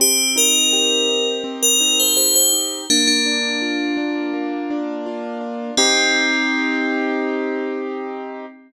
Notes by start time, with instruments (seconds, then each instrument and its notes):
0.00 acoustic grand piano C4, tubular bells G4
0.36 acoustic grand piano D#4, tubular bells A#4
0.73 acoustic grand piano G4
1.09 acoustic grand piano D#4
1.44 acoustic grand piano C4
1.63 tubular bells A#4
1.81 acoustic grand piano D#4
2.00 tubular bells C5
2.17 acoustic grand piano G4, tubular bells C5
2.36 tubular bells C5
2.53 acoustic grand piano D#4
2.90 acoustic grand piano A#3, tubular bells D4
3.08 tubular bells D4
3.26 acoustic grand piano D4
3.62 acoustic grand piano F4
3.97 acoustic grand piano D4
4.33 acoustic grand piano A#3
4.70 acoustic grand piano D4
5.06 acoustic grand piano F4
5.41 acoustic grand piano D4
5.77 tubular bells C4, acoustic grand piano C4 D#4 G4